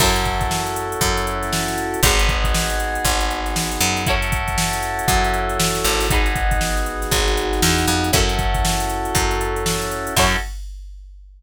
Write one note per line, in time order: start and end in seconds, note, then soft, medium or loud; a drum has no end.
0.00 0.95 F#2 loud
0.00 2.00 C#4 medium
0.00 2.00 E4 loud
0.00 2.01 E4 loud
0.00 2.00 F#4 medium
0.00 2.01 F#4 medium
0.00 2.00 A4 medium
0.00 2.01 A4 medium
0.00 2.01 C#5 loud
0.00 kick loud
0.00 crash loud
0.16 closed hi-hat medium
0.25 kick medium
0.25 closed hi-hat medium
0.41 kick loud
0.41 closed hi-hat medium
0.51 snare loud
0.67 closed hi-hat medium
0.76 closed hi-hat loud
0.92 closed hi-hat medium
1.01 1.96 F#2 loud
1.01 kick loud
1.01 closed hi-hat loud
1.17 closed hi-hat medium
1.27 closed hi-hat medium
1.43 snare soft
1.43 closed hi-hat medium
1.53 snare loud
1.68 snare medium
1.68 closed hi-hat medium
1.78 closed hi-hat medium
1.94 closed hi-hat medium
2.03 2.98 G#1 loud
2.03 4.03 B3 medium
2.03 4.03 D#4 medium
2.03 4.04 D#4 medium
2.03 4.03 F#4 medium
2.03 4.04 F#4 medium
2.03 4.03 G#4 loud
2.03 4.04 G#4 loud
2.03 4.04 B4 medium
2.03 kick loud
2.03 closed hi-hat loud
2.19 closed hi-hat loud
2.29 kick loud
2.29 closed hi-hat medium
2.44 kick loud
2.44 closed hi-hat medium
2.54 snare loud
2.70 snare soft
2.70 closed hi-hat medium
2.80 closed hi-hat medium
2.95 closed hi-hat medium
3.05 3.78 G#1 medium
3.05 kick loud
3.05 closed hi-hat loud
3.20 closed hi-hat medium
3.31 closed hi-hat medium
3.46 snare soft
3.46 closed hi-hat medium
3.56 snare loud
3.72 snare medium
3.72 closed hi-hat medium
3.81 5.01 F#2 loud
3.81 closed hi-hat medium
3.97 closed hi-hat medium
4.06 6.07 C#4 medium
4.06 6.07 E4 loud
4.06 6.07 E4 medium
4.06 6.07 F#4 loud
4.06 6.07 F#4 medium
4.06 6.07 A4 medium
4.06 6.07 C#5 medium
4.06 kick loud
4.06 closed hi-hat loud
4.22 closed hi-hat medium
4.32 kick loud
4.32 closed hi-hat loud
4.48 kick medium
4.48 closed hi-hat medium
4.58 snare loud
4.73 snare soft
4.73 closed hi-hat medium
4.83 snare soft
4.83 closed hi-hat medium
4.99 closed hi-hat medium
5.08 5.81 F#2 loud
5.08 kick loud
5.08 closed hi-hat loud
5.24 closed hi-hat medium
5.34 closed hi-hat medium
5.49 closed hi-hat medium
5.60 snare loud
5.75 snare medium
5.75 closed hi-hat medium
5.84 7.05 G#1 loud
5.84 closed hi-hat medium
6.00 snare soft
6.00 open hi-hat medium
6.10 8.10 B3 medium
6.10 8.10 D#4 medium
6.10 8.11 D#4 medium
6.10 8.10 F#4 loud
6.10 8.11 F#4 medium
6.10 8.10 G#4 medium
6.10 8.11 G#4 medium
6.10 8.11 B4 medium
6.10 kick loud
6.10 closed hi-hat loud
6.26 closed hi-hat medium
6.35 kick loud
6.35 closed hi-hat medium
6.51 kick loud
6.51 closed hi-hat medium
6.61 snare loud
6.77 closed hi-hat medium
6.86 closed hi-hat medium
7.02 snare medium
7.02 closed hi-hat medium
7.11 7.60 G#1 medium
7.11 kick loud
7.11 closed hi-hat loud
7.28 closed hi-hat medium
7.37 closed hi-hat medium
7.53 snare soft
7.53 closed hi-hat medium
7.62 7.86 E2 loud
7.62 snare loud
7.78 snare medium
7.78 closed hi-hat medium
7.88 8.11 F2 loud
7.88 closed hi-hat medium
8.04 closed hi-hat medium
8.12 9.09 F#2 loud
8.12 10.13 C#4 medium
8.12 10.14 C#4 medium
8.12 10.13 E4 medium
8.12 10.14 E4 medium
8.12 10.14 F#4 medium
8.12 10.13 F#4 medium
8.12 10.14 A4 medium
8.12 10.13 A4 loud
8.12 kick loud
8.12 closed hi-hat loud
8.29 closed hi-hat medium
8.39 kick loud
8.39 closed hi-hat medium
8.54 kick loud
8.54 closed hi-hat medium
8.65 snare loud
8.80 closed hi-hat loud
8.90 closed hi-hat medium
9.05 closed hi-hat medium
9.15 10.10 F#2 medium
9.15 kick loud
9.15 closed hi-hat loud
9.31 closed hi-hat medium
9.41 closed hi-hat loud
9.56 closed hi-hat medium
9.66 snare loud
9.82 snare medium
9.82 closed hi-hat medium
9.91 closed hi-hat medium
10.07 closed hi-hat medium
10.17 10.36 F#2 loud
10.17 10.37 C#4 loud
10.17 10.36 E4 loud
10.17 10.37 E4 medium
10.17 10.37 F#4 loud
10.17 10.36 F#4 loud
10.17 10.37 A4 loud
10.17 10.36 A4 medium
10.17 10.36 C#5 loud
10.17 kick loud
10.17 crash loud